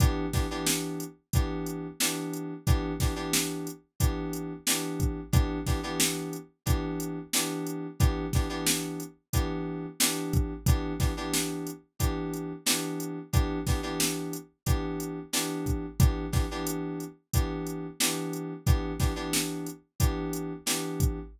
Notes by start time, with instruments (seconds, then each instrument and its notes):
0.00 electric piano 2 E3 B3 D4 G4, kick, closed hi-hat
0.33 electric piano 2 E3 B3 D4 G4, kick, snare, closed hi-hat
0.51 electric piano 2 E3 B3 D4 G4
0.67 snare
1.00 closed hi-hat
1.33 electric piano 2 E3 B3 D4 G4, kick, closed hi-hat
1.66 closed hi-hat
2.00 electric piano 2 E3 B3 D4 G4, snare
2.33 closed hi-hat
2.67 electric piano 2 E3 B3 D4 G4, kick, closed hi-hat
3.00 electric piano 2 E3 B3 D4 G4, kick, snare, closed hi-hat
3.16 electric piano 2 E3 B3 D4 G4
3.33 snare
3.67 closed hi-hat
4.00 electric piano 2 E3 B3 D4 G4, kick, closed hi-hat
4.33 closed hi-hat
4.67 electric piano 2 E3 B3 D4 G4, snare
5.00 kick, closed hi-hat
5.33 electric piano 2 E3 B3 D4 G4, kick, closed hi-hat
5.67 electric piano 2 E3 B3 D4 G4, kick, snare, closed hi-hat
5.83 electric piano 2 E3 B3 D4 G4
6.00 snare
6.33 closed hi-hat
6.66 electric piano 2 E3 B3 D4 G4, kick, closed hi-hat
7.00 closed hi-hat
7.33 electric piano 2 E3 B3 D4 G4, snare
7.67 closed hi-hat
8.00 electric piano 2 E3 B3 D4 G4, kick, closed hi-hat
8.33 electric piano 2 E3 B3 D4 G4, kick, snare, closed hi-hat
8.49 electric piano 2 E3 B3 D4 G4
8.67 snare
9.00 closed hi-hat
9.33 electric piano 2 E3 B3 D4 G4, kick, closed hi-hat
10.00 electric piano 2 E3 B3 D4 G4, snare
10.33 kick, closed hi-hat
10.66 electric piano 2 E3 B3 D4 G4, kick, closed hi-hat
11.00 electric piano 2 E3 B3 D4 G4, kick, snare, closed hi-hat
11.17 electric piano 2 E3 B3 D4 G4
11.33 snare
11.67 closed hi-hat
11.99 electric piano 2 E3 B3 D4 G4, kick, closed hi-hat
12.33 closed hi-hat
12.66 electric piano 2 E3 B3 D4 G4, snare
13.00 closed hi-hat
13.33 electric piano 2 E3 B3 D4 G4, kick, closed hi-hat
13.67 electric piano 2 E3 B3 D4 G4, kick, snare, closed hi-hat
13.83 electric piano 2 E3 B3 D4 G4
14.00 snare
14.33 closed hi-hat
14.66 electric piano 2 E3 B3 D4 G4, kick, closed hi-hat
15.00 closed hi-hat
15.33 electric piano 2 E3 B3 D4 G4, snare
15.66 kick, closed hi-hat
15.99 electric piano 2 E3 B3 D4 G4, kick, closed hi-hat
16.32 electric piano 2 E3 B3 D4 G4, kick, snare, closed hi-hat
16.51 electric piano 2 E3 B3 D4 G4
16.67 closed hi-hat
17.00 closed hi-hat
17.33 electric piano 2 E3 B3 D4 G4, kick, closed hi-hat
17.67 closed hi-hat
18.00 electric piano 2 E3 B3 D4 G4, snare
18.33 closed hi-hat
18.66 electric piano 2 E3 B3 D4 G4, kick, closed hi-hat
19.00 electric piano 2 E3 B3 D4 G4, kick, snare, closed hi-hat
19.16 electric piano 2 E3 B3 D4 G4
19.33 snare
19.67 closed hi-hat
20.00 electric piano 2 E3 B3 D4 G4, kick, closed hi-hat
20.33 closed hi-hat
20.66 electric piano 2 E3 B3 D4 G4, snare
21.00 kick, closed hi-hat